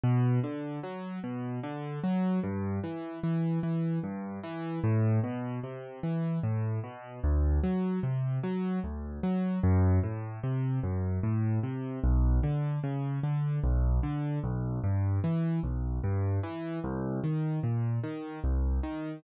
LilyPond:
\new Staff { \clef bass \time 3/4 \key g \major \tempo 4 = 75 b,8 d8 fis8 b,8 d8 fis8 | g,8 e8 e8 e8 g,8 e8 | a,8 b,8 c8 e8 a,8 b,8 | d,8 fis8 c8 fis8 d,8 fis8 |
fis,8 a,8 c8 fis,8 a,8 c8 | b,,8 d8 cis8 d8 b,,8 d8 | b,,8 g,8 e8 b,,8 g,8 e8 | c,8 ees8 bes,8 ees8 c,8 ees8 | }